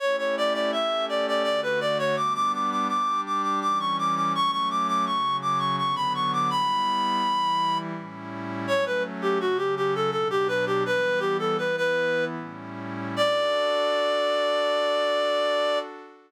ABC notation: X:1
M:3/4
L:1/16
Q:1/4=83
K:D
V:1 name="Clarinet"
c c d d e2 d d d B d c | d' d' d' d' d'2 d' d' d' c' d' d' | c' c' d' d' c'2 d' c' c' b c' d' | b8 z4 |
c B z G F G G A A G B G | "^rit." B2 G A B B3 z4 | d12 |]
V:2 name="Pad 5 (bowed)"
[A,CEG]4 [A,CGA]4 [D,A,F]4 | [G,B,D]4 [G,DG]4 [E,G,C]4 | [F,A,C]4 [C,F,C]4 [D,F,B,]4 | [G,B,E]4 [E,G,E]4 [A,,G,CE]4 |
[F,A,C]4 [C,F,C]4 [B,,F,D]4 | "^rit." [E,G,B,]4 [E,B,E]4 [A,,G,CE]4 | [DFA]12 |]